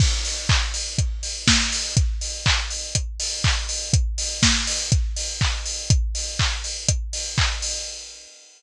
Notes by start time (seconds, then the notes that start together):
0.00 kick, crash
0.25 open hi-hat
0.49 kick, clap
0.74 open hi-hat
0.98 kick, closed hi-hat
1.23 open hi-hat
1.48 kick, snare
1.72 open hi-hat
1.97 kick, closed hi-hat
2.21 open hi-hat
2.46 kick, clap
2.70 open hi-hat
2.95 kick, closed hi-hat
3.20 open hi-hat
3.44 kick, clap
3.69 open hi-hat
3.93 kick, closed hi-hat
4.18 open hi-hat
4.43 kick, snare
4.67 open hi-hat
4.92 kick, closed hi-hat
5.16 open hi-hat
5.41 kick, clap
5.65 open hi-hat
5.90 kick, closed hi-hat
6.15 open hi-hat
6.39 kick, clap
6.64 open hi-hat
6.88 kick, closed hi-hat
7.13 open hi-hat
7.38 kick, clap
7.62 open hi-hat